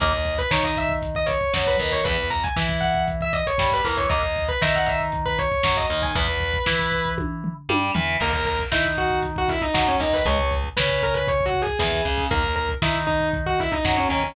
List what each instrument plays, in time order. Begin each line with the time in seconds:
0.00 electric bass (finger) D#2, overdriven guitar D#3 A#3, distortion guitar D#5, kick, closed hi-hat
0.13 kick
0.25 kick, closed hi-hat
0.38 distortion guitar B4, kick
0.51 electric bass (finger) D#3, overdriven guitar D#4, distortion guitar C#5, kick, snare
0.63 distortion guitar D#5, kick
0.76 distortion guitar E5, kick, closed hi-hat
0.89 kick
1.02 kick, closed hi-hat
1.15 distortion guitar D#5, kick
1.26 distortion guitar C#5, kick, closed hi-hat
1.41 kick
1.54 electric bass (finger) F#2, overdriven guitar F#3, kick, snare
1.67 distortion guitar B4, kick
1.79 electric bass (finger) D#2, overdriven guitar D#3, kick, closed hi-hat
1.92 distortion guitar C#5, kick
2.04 electric bass (finger) E2, overdriven guitar E3 B3, distortion guitar B4, kick, closed hi-hat
2.18 kick
2.30 distortion guitar A#5, kick, closed hi-hat
2.44 distortion guitar G#5, kick
2.56 electric bass (finger) E3, overdriven guitar E4, kick, snare
2.69 kick
2.81 distortion guitar F#5, kick, closed hi-hat
2.94 kick
3.08 kick, closed hi-hat
3.21 distortion guitar E5, kick
3.33 distortion guitar D#5, kick, closed hi-hat
3.47 distortion guitar C#5, kick
3.58 electric bass (finger) G2, overdriven guitar G3, kick, snare
3.72 distortion guitar B4, kick
3.84 electric bass (finger) E2, overdriven guitar E3, distortion guitar A#4, kick, closed hi-hat
3.97 distortion guitar C#5, kick
4.09 electric bass (finger) D#2, overdriven guitar D#3 A#3, distortion guitar D#5, kick, closed hi-hat
4.23 kick
4.36 kick, closed hi-hat
4.48 distortion guitar B4, kick
4.61 electric bass (finger) D#3, overdriven guitar D#4, distortion guitar E5, kick, snare
4.75 distortion guitar F#5, kick
4.86 distortion guitar E5, kick, closed hi-hat
5.01 kick
5.12 kick, closed hi-hat
5.26 distortion guitar B4, kick
5.39 distortion guitar C#5, kick, closed hi-hat
5.52 kick
5.63 electric bass (finger) F#2, overdriven guitar F#3, kick, snare
5.77 distortion guitar D#5, kick
5.90 electric bass (finger) D#2, overdriven guitar D#3, kick, closed hi-hat
6.02 distortion guitar G#5, kick
6.15 electric bass (finger) E2, overdriven guitar E3 B3, distortion guitar B4, kick, closed hi-hat
6.28 kick
6.40 kick, closed hi-hat
6.54 kick
6.66 electric bass (finger) E3, overdriven guitar E4, kick, snare
6.79 kick
6.92 kick, closed hi-hat
7.05 kick
7.18 kick, high tom
7.44 floor tom
7.69 electric bass (finger) G2, overdriven guitar G3, high tom
7.94 electric bass (finger) E2, overdriven guitar E3, floor tom
8.20 electric bass (finger) D#2, overdriven guitar D#3 A#3, distortion guitar A#4, kick, crash
8.33 kick
8.45 distortion guitar A#4, kick, closed hi-hat
8.59 kick
8.72 electric bass (finger) D#3, overdriven guitar D#4, distortion guitar E4, kick, snare
8.85 kick
8.97 distortion guitar F#4, kick, closed hi-hat
9.10 kick
9.23 kick, closed hi-hat
9.36 distortion guitar F#4, kick
9.48 distortion guitar E4, kick, closed hi-hat
9.61 distortion guitar D#4, kick
9.74 electric bass (finger) F#2, overdriven guitar F#3, kick, snare
9.87 distortion guitar C#4, kick
9.99 electric bass (finger) D#2, overdriven guitar D#3, distortion guitar D#4, kick, closed hi-hat
10.13 distortion guitar B4, kick
10.26 electric bass (finger) C#2, overdriven guitar C#3 G#3, distortion guitar C#5, kick, closed hi-hat
10.38 kick
10.51 kick, closed hi-hat
10.64 kick
10.77 electric bass (finger) C#3, overdriven guitar C#4, distortion guitar B4, kick, snare
10.89 kick
11.03 distortion guitar A#4, kick, closed hi-hat
11.14 distortion guitar B4, kick
11.27 distortion guitar C#5, kick, closed hi-hat
11.41 kick
11.46 distortion guitar F#4
11.54 kick, closed hi-hat
11.62 distortion guitar G#4
11.67 kick
11.79 electric bass (finger) E2, overdriven guitar E3, distortion guitar G#4, kick, snare
11.92 kick
12.05 electric bass (finger) C#2, overdriven guitar C#3, kick, closed hi-hat
12.18 kick
12.30 electric bass (finger) D#2, overdriven guitar D#3 A#3, distortion guitar A#4, kick, closed hi-hat
12.44 kick
12.56 distortion guitar A#4, kick, closed hi-hat
12.69 kick
12.82 electric bass (finger) D#3, overdriven guitar D#4, distortion guitar E4, kick, snare
12.94 kick
13.07 distortion guitar D#4, kick, closed hi-hat
13.21 kick
13.33 kick, closed hi-hat
13.46 distortion guitar F#4, kick
13.58 distortion guitar E4, kick, closed hi-hat
13.72 distortion guitar D#4, kick
13.85 electric bass (finger) F#2, overdriven guitar F#3, kick, snare
13.97 distortion guitar C#4, kick
14.09 electric bass (finger) D#2, overdriven guitar D#3, distortion guitar C#4, kick, closed hi-hat
14.23 distortion guitar C#4, kick